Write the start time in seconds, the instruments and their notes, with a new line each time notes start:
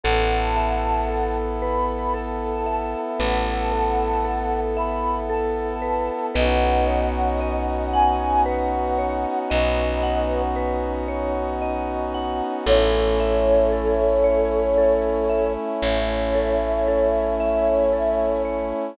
0.04 electric bass (finger) A1, pad 5 (bowed) B3 E4 A4, vibraphone A4, flute F#5 A5
0.56 vibraphone E5
1.09 vibraphone A4
1.61 vibraphone B4, flute B5
2.14 vibraphone A4, flute A5
2.66 vibraphone E5
3.19 electric bass (finger) A1, vibraphone B4, flute F#5 A5
3.72 vibraphone A4
4.25 vibraphone A4
4.77 vibraphone E5, flute B5
5.30 vibraphone A4, flute A5
5.82 vibraphone B4
6.35 electric bass (finger) B1, pad 5 (bowed) B3 C#4 D#4 F#4, vibraphone B4, flute D#5 F#5
6.87 vibraphone C#5
7.41 vibraphone D#5
7.93 vibraphone F#5, flute G#5
8.46 vibraphone B4, flute F#5
8.98 vibraphone C#5
9.50 electric bass (finger) B1, flute B4 D#5, vibraphone D#5
10.03 vibraphone F#5
10.56 vibraphone B4
11.08 vibraphone C#5
11.62 vibraphone D#5
12.14 vibraphone F#5
12.66 electric bass (finger) A1, pad 5 (bowed) A3 C#4 E4, vibraphone A4, flute A4 C#5
13.20 vibraphone E5
13.73 vibraphone A4
14.24 vibraphone C#5
14.78 vibraphone A4
15.30 vibraphone E5
15.82 electric bass (finger) A1, vibraphone C#5, flute C#5 E5
16.35 vibraphone A4
16.88 vibraphone A4
17.40 vibraphone E5
17.93 vibraphone A4
18.45 vibraphone C#5